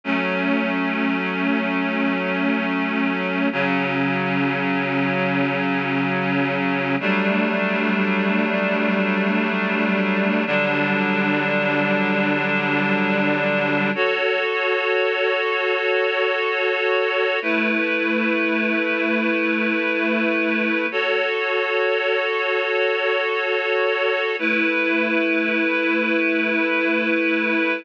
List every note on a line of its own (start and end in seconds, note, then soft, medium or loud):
0.04 3.48 F#3 medium
0.04 3.48 A3 medium
0.04 3.48 C#4 medium
3.52 6.96 C#3 loud
3.52 6.96 F#3 loud
3.52 6.96 C#4 medium
7.00 10.44 F#3 medium
7.00 10.44 G3 loud
7.00 10.44 A3 medium
7.00 10.44 D4 medium
10.46 13.90 D3 loud
10.46 13.90 F#3 medium
10.46 13.90 G3 medium
10.46 13.90 D4 loud
13.95 17.39 F#4 medium
13.95 17.39 A4 medium
13.95 17.39 C#5 medium
17.42 20.86 A3 medium
17.42 20.86 E4 medium
17.42 20.86 B4 medium
20.91 24.36 F#4 medium
20.91 24.36 A4 medium
20.91 24.36 C#5 medium
24.39 27.83 A3 medium
24.39 27.83 E4 medium
24.39 27.83 B4 medium